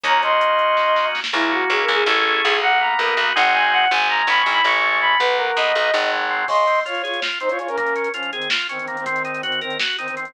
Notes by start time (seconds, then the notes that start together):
0.03 D#2 A#3 C#4 D#4 F#4 C#5 A#5, kick, closed hi-hat
0.22 D#5 C6, closed hi-hat
0.41 closed hi-hat
0.59 closed hi-hat
0.77 kick, snare
0.96 snare
1.15 snare
1.24 snare
1.33 C#2 A#3 E4
1.52 C#4 F#4
1.70 C#2 E4 G#4
1.83 A#4
1.88 C#2 G#4
1.94 G#4
2.06 A1 A3 C#4 E4 G#4 A4
2.44 B1 G#4
2.62 A#3 F#5
2.81 B3 A#5
2.99 B1 D#4 A#4
3.17 B1 F#4
3.35 G#1 G#3 C4 D#4 F#4 F#5
3.54 G#5
3.72 F#5
3.91 G#1 G#3 G#5
4.09 A#3 A#5
4.27 G#1 C#4 B5
4.40 C#6
4.46 G#1 E4
4.52 B5
4.64 A1 G#3 C#6
4.83 A3
5.01 C#4 B5
5.19 B1 F#3 B4
5.38 A#3 A#4
5.57 B1 B3 D#5
5.75 B1 D#4
5.93 G#1 F#3
6.12 G#3
6.30 C4
6.48 C#3 D#5 C6, kick, crash
6.57 closed hi-hat
6.67 C4, closed hi-hat
6.75 closed hi-hat
6.86 F4 C#5, closed hi-hat
6.95 closed hi-hat
7.04 F4 G#4 C#5, closed hi-hat
7.14 closed hi-hat
7.22 F4, snare
7.32 closed hi-hat
7.40 C4 D#4 C5, closed hi-hat
7.49 F4 C#5, closed hi-hat
7.59 C#3 F4 C#5, closed hi-hat
7.68 C#4 A#4, closed hi-hat
7.77 A#3 C#4 A#4, kick, closed hi-hat
7.87 closed hi-hat
7.96 C#4, closed hi-hat
8.04 closed hi-hat
8.14 F3 C#4 F4, closed hi-hat
8.23 closed hi-hat
8.33 D#3 C4 G#4, closed hi-hat
8.42 closed hi-hat
8.50 F4, snare
8.60 closed hi-hat
8.69 D#3 C4 C#4, closed hi-hat
8.79 D#3 C4, closed hi-hat
8.87 D#3 A#3 C4, closed hi-hat
8.97 D#3 C4, closed hi-hat
9.06 D#3 C4, kick, closed hi-hat
9.16 closed hi-hat
9.25 D#4, closed hi-hat
9.35 closed hi-hat
9.43 D#3 C4 F#4, closed hi-hat
9.52 closed hi-hat
9.61 D#3 C4 A#4, closed hi-hat
9.70 closed hi-hat
9.80 F#4, snare
9.90 closed hi-hat
9.98 D#3 C4 D#4, closed hi-hat
10.08 D#3 C4, closed hi-hat
10.17 D#3 C4, closed hi-hat
10.25 D#3 C4, closed hi-hat